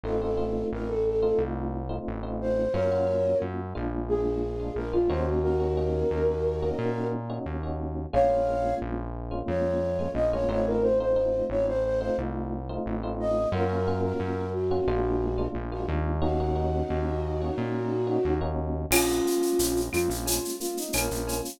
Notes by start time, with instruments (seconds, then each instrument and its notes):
0.04 synth bass 1 A1, electric piano 1 A3 C4 D#4 F4, flute A4
0.21 electric piano 1 A3 C4 D#4 F4, flute A4
0.37 electric piano 1 A3 C4 D#4 F4
0.72 synth bass 1 A1, flute A#4
0.88 flute A4
1.06 flute A4
1.22 electric piano 1 A3 C4 D#4 F4, flute A4
1.38 synth bass 1 C2
1.89 electric piano 1 A3 C4 D#4 F4
2.07 synth bass 1 A1
2.23 electric piano 1 A3 C4 D#4 F4
2.41 flute C5
2.73 synth bass 1 F#2, electric piano 1 A#3 C#4 F4 F#4, flute A#4 C#5
2.92 electric piano 1 A#3 C#4 F4 F#4
3.07 electric piano 1 A#3 C#4 F4 F#4
3.42 synth bass 1 F#2
3.75 synth bass 1 A#1, electric piano 1 G#3 A#3 D4 F4
4.08 flute G#4
4.60 electric piano 1 G#3 A#3 D4 F4
4.76 synth bass 1 A#1, flute A#4
4.93 electric piano 1 G#3 A#3 D4 F4, flute F4
5.09 synth bass 1 D#2, electric piano 1 A#3 C#4 D#4 F#4, flute C5
5.26 flute F#4
5.43 flute F#4 A#4
5.60 electric piano 1 A#3 C#4 D#4 F#4
5.77 electric piano 1 A#3 C#4 D#4 F#4
6.11 synth bass 1 D#2
6.62 electric piano 1 A#3 C#4 D#4 F#4
6.78 synth bass 1 A#2
7.30 electric piano 1 A#3 C#4 D#4 F#4
7.46 synth bass 1 D#2
7.63 electric piano 1 A#3 C#4 D#4 F#4
8.13 synth bass 1 A#1, electric piano 1 G#3 A#3 C#4 F4, flute C#5 F5
8.29 electric piano 1 G#3 A#3 C#4 F4
8.47 electric piano 1 G#3 A#3 C#4 F4
8.82 synth bass 1 A#1
9.31 electric piano 1 G#3 A#3 C#4 F4
9.48 synth bass 1 F2, flute C#5
9.99 electric piano 1 G#3 A#3 C#4 F4
10.14 synth bass 1 A#1, flute D#5
10.32 electric piano 1 G#3 A#3 C#4 F4, flute C#5
10.48 synth bass 1 A1, electric piano 1 A3 C4 D#4 F4, flute C#5
10.66 flute A#4
10.82 flute C5
11.00 electric piano 1 A3 C4 D#4 F4, flute C5
11.16 electric piano 1 A3 C4 D#4 F4
11.50 synth bass 1 A1, flute C#5
11.68 flute C5
11.85 flute C5
12.00 electric piano 1 A3 C4 D#4 F4, flute C5
12.18 synth bass 1 C2
12.69 electric piano 1 A3 C4 D#4 F4
12.86 synth bass 1 A1
13.03 electric piano 1 A3 C4 D#4 F4
13.20 flute D#5
13.52 synth bass 1 F#2, electric piano 1 A#3 C#4 F4 F#4, flute A#4
13.69 electric piano 1 A#3 C#4 F4 F#4
13.87 electric piano 1 A#3 C#4 F4 F#4
14.03 flute A#4
14.20 synth bass 1 F#2
14.53 flute F#4
14.71 electric piano 1 A#3 C#4 F4 F#4
14.87 synth bass 1 A#1, electric piano 1 G#3 A#3 D4 F4
15.38 electric piano 1 G#3 A#3 D4 F4
15.55 synth bass 1 A#1
15.72 electric piano 1 G#3 A#3 D4 F4, flute F#4
15.88 synth bass 1 D#2
16.22 electric piano 1 A#3 C#4 D#4 F#4, flute D#4 F#4
16.40 electric piano 1 A#3 C#4 D#4 F#4
16.55 electric piano 1 A#3 C#4 D#4 F#4
16.90 synth bass 1 D#2
17.41 electric piano 1 A#3 C#4 D#4 F#4
17.58 synth bass 1 A#2
18.07 electric piano 1 A#3 C#4 D#4 F#4
18.25 synth bass 1 D#2
18.41 electric piano 1 A#3 C#4 D#4 F#4
18.91 synth bass 1 A#1, electric piano 1 G#3, flute C#4 F4, crash, cowbell, claves
19.08 shaker
19.25 electric piano 1 A#3, shaker
19.42 shaker
19.59 synth bass 1 A#1, electric piano 1 C#4, shaker
19.76 shaker
19.93 synth bass 1 F2, electric piano 1 F4, flute F4, claves, shaker
20.09 synth bass 1 A#1, shaker
20.26 electric piano 1 G#3, flute F4, cowbell, shaker
20.45 shaker
20.60 electric piano 1 A#3, flute F4, shaker
20.77 flute D#4, shaker
20.93 synth bass 1 A#1, electric piano 1 C#4, flute A#4, cowbell, claves, shaker
21.11 synth bass 1 A#1, shaker
21.27 electric piano 1 F4, cowbell, shaker
21.45 shaker